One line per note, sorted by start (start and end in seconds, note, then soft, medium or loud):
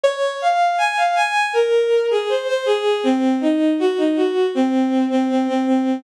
0.03 0.36 C#5 loud
0.42 0.75 F5 medium
0.78 0.96 G#5 medium
0.97 1.15 F5 medium
1.15 1.46 G#5 medium
1.53 2.06 A#4 medium
2.10 2.28 G#4 medium
2.29 2.47 C5 medium
2.47 2.65 C5 medium
2.65 3.01 G#4 medium
3.03 3.35 C4 loud
3.41 3.73 D#4 medium
3.79 3.97 F#4 loud
3.97 4.15 D#4 medium
4.15 4.47 F#4 medium
4.55 5.05 C4 medium
5.10 5.27 C4 medium
5.29 5.47 C4 medium
5.47 5.65 C4 medium
5.67 6.01 C4 medium